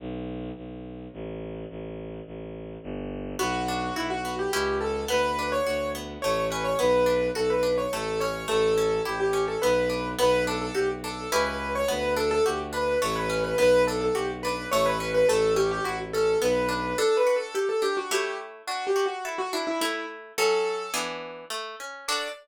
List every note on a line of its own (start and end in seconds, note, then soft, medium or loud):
0.00 0.51 B1 medium
0.57 1.08 B1 medium
1.13 1.65 A1 medium
1.70 2.21 A1 medium
2.26 2.77 A1 medium
2.83 3.35 G1 medium
3.39 3.91 B1 medium
3.39 4.24 B3 medium
3.39 3.94 F#4 loud
3.68 4.49 D4 medium
3.96 4.47 B1 medium
3.96 4.10 E4 medium
3.96 4.50 F#4 medium
4.10 4.35 F#4 medium
4.25 4.52 B3 medium
4.39 4.52 G4 medium
4.52 5.05 C#2 medium
4.52 5.04 C#4 medium
4.52 5.04 E4 medium
4.52 4.77 G4 medium
4.52 5.04 G4 medium
4.81 5.08 A4 medium
5.08 5.60 D2 medium
5.08 5.94 B3 medium
5.08 5.51 B4 loud
5.39 6.19 D4 medium
5.52 5.89 C#5 medium
5.66 6.17 D2 medium
5.66 6.20 F#4 medium
5.95 6.22 B3 medium
6.22 6.75 A1 medium
6.22 6.78 A3 medium
6.22 6.45 C#5 medium
6.50 6.79 C#4 medium
6.50 6.64 B4 medium
6.64 6.78 C#5 medium
6.79 7.30 B1 medium
6.79 7.04 B3 medium
6.79 7.28 B4 medium
7.06 7.32 D4 medium
7.35 7.87 B1 medium
7.35 7.61 F#4 medium
7.35 7.50 A4 medium
7.50 7.76 B4 medium
7.63 7.88 D4 medium
7.78 7.91 C#5 medium
7.92 8.45 A1 medium
7.92 8.18 A3 medium
7.92 8.20 A4 medium
8.20 8.47 C#4 medium
8.20 8.46 C#5 medium
8.48 9.00 A1 medium
8.48 8.73 A3 medium
8.48 9.02 A4 loud
8.78 9.03 C#4 medium
9.05 9.57 A1 medium
9.05 9.31 E4 medium
9.05 9.19 G4 medium
9.20 9.45 G4 medium
9.33 9.59 C#4 medium
9.48 9.61 A4 medium
9.62 10.14 B1 medium
9.62 9.89 B3 medium
9.62 10.08 B4 medium
9.90 10.15 D4 medium
10.19 10.70 B1 medium
10.19 10.44 B3 loud
10.19 10.44 B4 loud
10.47 10.73 D4 medium
10.47 10.61 A4 medium
10.62 10.75 A4 medium
10.75 11.26 B1 medium
10.75 11.00 F#4 medium
10.75 10.89 G4 medium
11.04 11.29 D4 medium
11.04 11.28 A4 medium
11.32 11.84 C#2 medium
11.32 11.83 C#4 medium
11.32 11.83 E4 medium
11.32 11.83 G4 medium
11.32 11.45 B4 medium
11.46 11.73 B4 medium
11.75 11.89 C#5 loud
11.88 12.40 D2 medium
11.88 12.14 B3 medium
11.88 12.12 B4 loud
12.17 12.42 D4 medium
12.17 12.30 A4 medium
12.31 12.44 A4 loud
12.45 12.96 D2 medium
12.45 12.71 F#4 medium
12.45 12.59 G4 medium
12.73 12.98 D4 medium
12.73 12.99 B4 medium
13.02 13.54 A1 medium
13.02 13.27 A3 medium
13.02 13.15 C#5 loud
13.16 13.43 B4 medium
13.30 13.55 C#4 medium
13.44 13.58 B4 medium
13.58 14.09 B1 medium
13.58 13.84 B3 medium
13.58 13.82 B4 loud
13.87 14.14 D4 medium
13.87 14.01 A4 medium
14.01 14.15 A4 medium
14.15 14.66 B1 medium
14.15 14.40 F#4 medium
14.15 14.28 G4 medium
14.43 14.70 D4 medium
14.43 14.66 B4 loud
14.71 15.24 A1 medium
14.71 14.98 A3 loud
14.71 14.85 C#5 loud
14.86 15.10 B4 loud
15.00 15.26 C#4 medium
15.14 15.28 B4 loud
15.28 15.79 A1 medium
15.28 15.55 A3 medium
15.28 15.53 A4 loud
15.56 15.82 C#4 medium
15.56 15.70 G4 medium
15.71 15.85 G4 loud
15.84 16.36 A1 medium
15.84 16.11 E4 medium
15.84 15.98 F#4 loud
16.13 16.40 C#4 medium
16.13 16.38 A4 loud
16.42 16.94 B1 medium
16.42 16.67 B3 medium
16.42 16.97 B4 medium
16.69 16.94 D4 medium
16.98 17.81 D4 medium
16.98 17.16 A4 loud
17.17 17.35 B4 medium
17.27 18.07 F#4 medium
17.36 17.54 A4 medium
17.55 17.68 G4 medium
17.55 18.09 A4 medium
17.69 17.82 A4 medium
17.82 18.09 D4 medium
17.82 17.96 G4 loud
17.97 18.10 F#4 medium
18.11 18.62 A3 medium
18.11 18.62 E4 medium
18.11 18.37 G4 medium
18.11 18.62 C#5 medium
18.67 19.52 D4 medium
18.67 18.85 F#4 loud
18.87 19.05 G4 medium
18.96 19.76 F#4 medium
19.06 19.24 F#4 medium
19.25 19.38 E4 medium
19.25 19.79 A4 medium
19.38 19.52 F#4 loud
19.53 19.80 D4 medium
19.53 19.67 E4 medium
19.67 19.81 E4 medium
19.81 20.32 A3 medium
19.81 20.05 E4 medium
19.81 20.32 E4 medium
19.81 20.32 C#5 medium
20.38 20.89 F#3 medium
20.38 20.89 C#4 medium
20.38 20.89 A4 medium
20.38 20.93 A4 loud
20.94 21.45 E3 medium
20.94 21.45 B3 medium
20.94 21.45 D4 medium
20.94 21.45 G#4 medium
21.50 21.76 A3 medium
21.80 22.05 C#4 medium
22.08 22.28 D4 medium
22.08 22.28 F#4 medium
22.08 22.28 A4 medium
22.08 22.28 D5 loud